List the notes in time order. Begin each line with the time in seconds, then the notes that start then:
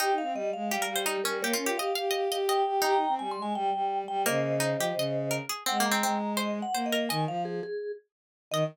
0.00 D#4 G4 G5
0.11 D#4
0.18 F5
0.22 C4
0.34 G3 D#5
0.53 G#3 F5
0.70 G3 G4
0.82 A#4
0.87 G3
0.96 C5
1.06 D#4 G4
1.24 G3 C#4 A#4
1.42 A#3 G4 A#4 C#5
1.53 C#4 F4
1.65 F4 G4
1.77 G4 D#5 F5
1.95 G4 F5
2.11 G4 D#5
2.31 G4 D#5
2.49 D#5 G5
2.66 G4
2.82 D#4 G4 G5 A#5
2.94 D#4
3.08 C4
3.19 G3 G#5
3.31 C6
3.38 G#3
3.42 G#5
3.55 G3 G5
3.74 G3
4.08 G3 G5
4.26 C#3 A#3 C5 D#5
4.60 D#4
4.78 F3 G4
4.96 C#3 D#5
5.31 A#4
5.49 G#4
5.66 G#3 C4 F#5
5.80 A#3
5.86 A#5
5.91 C4
6.03 G#3 C4
6.37 C5 D#5
6.62 F#5
6.74 A#3 C5
6.86 D#5
6.92 A#4
7.09 D#3 D#5 G#5
7.27 F3 F5
7.45 G#4
7.63 G#4
8.51 D#3 D#5